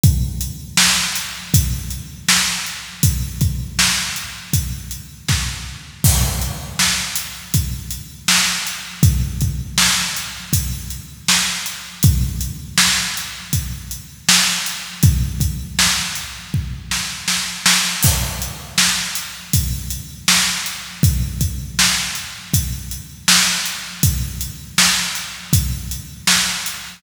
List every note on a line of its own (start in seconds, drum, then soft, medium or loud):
0.03 kick loud
0.03 closed hi-hat loud
0.41 closed hi-hat medium
0.77 snare loud
1.15 closed hi-hat loud
1.54 kick loud
1.54 closed hi-hat loud
1.90 closed hi-hat medium
2.28 snare loud
2.66 closed hi-hat medium
3.03 kick loud
3.03 closed hi-hat loud
3.41 kick loud
3.41 closed hi-hat medium
3.79 snare loud
4.16 closed hi-hat medium
4.53 kick loud
4.53 closed hi-hat loud
4.91 closed hi-hat medium
5.28 kick loud
5.28 snare medium
6.04 kick loud
6.04 crash loud
6.42 closed hi-hat medium
6.79 snare loud
7.15 closed hi-hat loud
7.54 kick loud
7.54 closed hi-hat loud
7.91 closed hi-hat medium
8.28 snare loud
8.67 closed hi-hat medium
9.03 kick loud
9.03 closed hi-hat loud
9.41 kick loud
9.41 closed hi-hat medium
9.78 snare loud
10.16 closed hi-hat medium
10.53 kick loud
10.53 closed hi-hat loud
10.90 closed hi-hat medium
11.28 snare loud
11.66 closed hi-hat medium
12.03 kick loud
12.03 closed hi-hat loud
12.41 closed hi-hat medium
12.78 snare loud
13.17 closed hi-hat medium
13.53 kick medium
13.53 closed hi-hat loud
13.91 closed hi-hat medium
14.29 snare loud
14.66 closed hi-hat medium
15.03 kick loud
15.03 closed hi-hat loud
15.40 kick loud
15.40 closed hi-hat loud
15.79 snare loud
16.15 closed hi-hat medium
16.54 kick medium
16.91 snare medium
17.28 snare loud
17.66 snare loud
18.03 kick loud
18.03 crash loud
18.42 closed hi-hat medium
18.78 snare loud
19.15 closed hi-hat loud
19.53 kick loud
19.53 closed hi-hat loud
19.90 closed hi-hat medium
20.28 snare loud
20.66 closed hi-hat medium
21.03 kick loud
21.03 closed hi-hat loud
21.41 kick medium
21.41 closed hi-hat loud
21.79 snare loud
22.15 closed hi-hat medium
22.53 kick loud
22.53 closed hi-hat loud
22.91 closed hi-hat medium
23.28 snare loud
23.65 closed hi-hat medium
24.03 kick loud
24.03 closed hi-hat loud
24.41 closed hi-hat medium
24.78 snare loud
25.15 closed hi-hat medium
25.53 kick loud
25.53 closed hi-hat loud
25.91 closed hi-hat medium
26.27 snare loud
26.66 closed hi-hat medium